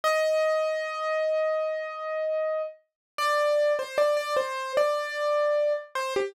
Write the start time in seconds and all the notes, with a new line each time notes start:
0.04 D#5
3.18 D5
3.79 C5
3.98 D5
4.17 D5
4.37 C5
4.77 D5
5.95 C5
6.16 G4